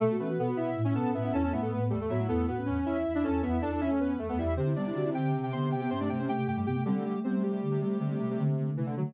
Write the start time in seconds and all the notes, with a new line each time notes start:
0.00 B2 A3 A4
0.11 F#4
0.19 E3 A3 B3 C#4 B4
0.29 F#4
0.38 B2 B3 A4
0.47 F#4
0.56 B2 E4 E5
0.75 A2
0.84 C#4 E4 E5
0.93 B2 B3 C#4 A4 A5
1.13 A2 B3 E4 E5
1.24 C#4 E4 E5
1.32 E2 C#4 E4 A4 A5
1.43 B3 C#4 A4 A5
1.52 A2 A3 B3 E4 E5
1.61 A3 B3 A4
1.70 A2 A3 B3 B4
1.80 B3
1.90 E2 G3 A3 A4
2.00 E2 A3 A4
2.09 A2 F#3 B3 E4 E5
2.19 A3
2.28 E2 A3 B3 E4 A4
2.47 A2 B3 F#4 B4
2.57 C#4
2.66 E2 C#4
2.85 E2 E4 E5
3.06 E2
3.14 D4 E4 E5
3.24 E2 C#4 A4 A5
3.42 E2 B3 E4 E5
3.53 E4 E5
3.62 E2 D4 A4 A5
3.72 D4 A4 A5
3.80 E2 C#4 E4 E5
3.90 A3 A4
4.00 E2 B3 B4
4.19 E2 A3 A4
4.28 E2 A3 B3 A4
4.38 E2 G3 E4 E5
4.56 C3 D3 C4 G4 C5
4.66 E4
4.75 G3 B3 D4 D5
4.86 E4
4.94 D3 F#4
5.05 E4
5.14 D3 C4 G4 G5
5.34 C3
5.43 G4 G5
5.52 D3 B3 C5 C6
5.72 C3 G4 G5
5.81 B3 G4 G5
5.90 G2 C#4 C5 C6
6.00 A3 D4 D5
6.09 C3 A3 G4 G5
6.19 C4 C#4 C5
6.29 C3 A3 G4 G5
6.38 A3
6.47 G2 A3 G4 G5
6.57 G2 G3 A3 G4
6.66 C3 B3 G4 G5
6.76 A3
6.85 D3 G3 C4 G4
6.97 A3
7.05 D3 G3 A3
7.15 A3
7.24 C3 G3 B3 C4 C5
7.34 A3
7.43 G3 A3 G4
7.52 G3 G4
7.63 D3
7.71 C3
7.80 C3 G3 A3
7.99 C3 D3
8.10 A3
8.19 C3 A3
8.29 C3 A3
8.38 C3 D3 A3
8.48 A3
8.57 D3 A3
8.68 A3
8.76 C3 E3 A3
8.85 C3 D3 A3
8.96 D3 F#3 A3
9.05 A3